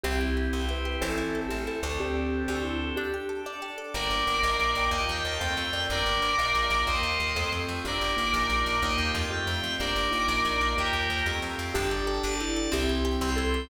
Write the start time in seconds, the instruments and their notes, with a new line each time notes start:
0.04 electric bass (finger) C2, drawbar organ C4 E4 G4, pizzicato strings C4, acoustic grand piano C4 E4 G4, vibraphone G4
0.21 pizzicato strings E4
0.37 pizzicato strings G4
0.53 electric bass (finger) C2, pizzicato strings C4, drawbar organ C4 G4 C5
0.69 pizzicato strings E4, vibraphone B4
0.85 pizzicato strings G4
1.01 electric bass (finger) A1, acoustic grand piano C4 E4 A4, drawbar organ C4 E4 A4, pizzicato strings C4, vibraphone A4
1.18 pizzicato strings E4
1.35 pizzicato strings A4
1.49 electric bass (finger) A1, drawbar organ A3 C4 A4, pizzicato strings C4, vibraphone G4
1.67 pizzicato strings E4, vibraphone A4
1.83 electric bass (finger) D2, pizzicato strings A4
2.00 acoustic grand piano C4 D4 G4 A4, drawbar organ C4 D4 G4 A4, vibraphone G4
2.48 electric bass (finger) D2, drawbar organ C4 D4 A4 C5, vibraphone G4
2.64 vibraphone E4
2.96 drawbar organ D4 G4 A4, pizzicato strings D4, vibraphone G4
3.14 pizzicato strings G4
3.29 pizzicato strings A4
3.45 drawbar organ D4 A4 D5, pizzicato strings D4
3.62 pizzicato strings G4
3.78 pizzicato strings A4
3.94 electric bass (finger) G1, drawbar organ A#3 D4 G4, acoustic grand piano A#4 D5 G5, electric piano 2 A#4 D5
4.10 electric bass (finger) G1
4.27 electric bass (finger) G1
4.42 electric bass (finger) A#1, drawbar organ A#3 D#4 F4, acoustic grand piano A#4 D#5 F5
4.59 electric bass (finger) A#1
4.75 electric bass (finger) A#1, acoustic grand piano A#4 D#5 F5 G5
4.91 electric bass (finger) D#2, drawbar organ A#3 D#4 F4 G4, electric piano 2 D#5
5.09 electric bass (finger) D#2, electric piano 2 G5
5.25 electric bass (finger) D#2, electric piano 2 A5
5.39 electric bass (finger) F2, drawbar organ A3 C4 F4 G4, acoustic grand piano A4 C5 F5 G5, electric piano 2 G5
5.57 electric bass (finger) F2
5.73 electric bass (finger) F2, acoustic grand piano A#4 D5 G5
5.90 electric bass (finger) G1, drawbar organ A#3 D4 G4, electric piano 2 A#4 D5
6.06 electric bass (finger) G1
6.22 electric bass (finger) G1
6.38 electric bass (finger) A#1, drawbar organ A#3 D#4 F4, acoustic grand piano A#4 D#5 F5
6.55 electric bass (finger) A#1
6.70 electric bass (finger) A#1
6.87 electric bass (finger) D#2, drawbar organ A#3 D#4 F4 G4, acoustic grand piano A#4 D#5 F5 G5, electric piano 2 C5 D#5
7.03 electric bass (finger) D#2
7.20 electric bass (finger) D#2
7.35 electric bass (finger) F2, drawbar organ A3 C4 F4 G4, acoustic grand piano A4 C5 F5 G5
7.52 electric bass (finger) F2
7.68 electric bass (finger) F2
7.84 electric bass (finger) G1, acoustic grand piano A#3 D4 G4, drawbar organ A#3 D4 G4, electric piano 2 A#4 D5
8.01 electric bass (finger) G1
8.16 electric bass (finger) G1, acoustic grand piano A#3 D#4 F4
8.33 electric bass (finger) A#1, drawbar organ A#3 D#4 F4
8.49 electric bass (finger) A#1
8.66 electric bass (finger) A#1
8.82 electric bass (finger) D#2, acoustic grand piano A#3 D#4 F4 G4, drawbar organ A#3 D#4 F4 G4, electric piano 2 D#5
8.97 electric bass (finger) D#2, electric piano 2 G5
9.14 electric bass (finger) F2, electric piano 2 A5
9.30 acoustic grand piano A3 C4 F4 G4, drawbar organ A3 C4 F4 G4, electric piano 2 G5
9.47 electric bass (finger) F2
9.63 electric bass (finger) F2
9.80 electric bass (finger) G1, acoustic grand piano A#3 D4 G4, drawbar organ A#3 D4 G4, electric piano 2 A#4 D5
9.96 electric bass (finger) G1
10.11 electric bass (finger) G1, acoustic grand piano A#3 D#4 F4
10.28 electric bass (finger) A#1, drawbar organ A#3 D#4 F4
10.45 electric bass (finger) A#1
10.61 electric bass (finger) A#1
10.76 electric bass (finger) D#2, acoustic grand piano A#3 D#4 F4 G4, drawbar organ A#3 D#4 F4 G4, electric piano 2 G4 A#4
10.93 electric bass (finger) D#2
11.10 electric bass (finger) D#2
11.26 electric bass (finger) F2, drawbar organ A3 C4 F4 G4, acoustic grand piano A3 C4 F4 G4
11.42 electric bass (finger) F2
11.59 electric bass (finger) F2
11.74 electric bass (finger) G1, acoustic grand piano D4 G4 A4, pizzicato strings D4, vibraphone G4, drawbar organ D5 G5 A5
11.91 pizzicato strings G4
12.07 pizzicato strings A4
12.23 electric bass (finger) G1, pizzicato strings D4, drawbar organ D5 A5 D6
12.40 vibraphone E4, pizzicato strings G4
12.56 pizzicato strings A4
12.72 electric bass (finger) C2, pizzicato strings C4, acoustic grand piano C4 E4 G4, vibraphone G4, drawbar organ C5 E5 G5
12.89 pizzicato strings E4
13.05 pizzicato strings G4
13.21 electric bass (finger) C2, pizzicato strings C4, drawbar organ C5 G5 C6
13.36 pizzicato strings E4, vibraphone A4
13.54 pizzicato strings G4